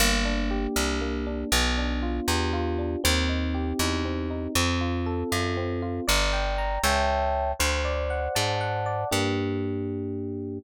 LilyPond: <<
  \new Staff \with { instrumentName = "Electric Piano 1" } { \time 6/8 \key g \minor \tempo 4. = 79 bes8 d'8 g'8 d'8 bes8 d'8 | b8 d'8 f'8 g'8 f'8 d'8 | c'8 ees'8 g'8 ees'8 c'8 ees'8 | c'8 f'8 a'8 f'8 c'8 f'8 |
d''8 g''8 bes''8 <cis'' e'' g'' a''>4. | c''8 d''8 fis''8 a''8 fis''8 d''8 | <bes d' g'>2. | }
  \new Staff \with { instrumentName = "Electric Bass (finger)" } { \clef bass \time 6/8 \key g \minor g,,4. c,4. | b,,4. e,4. | ees,4. e,4. | f,4. fis,4. |
g,,4. cis,4. | d,4. aes,4. | g,2. | }
>>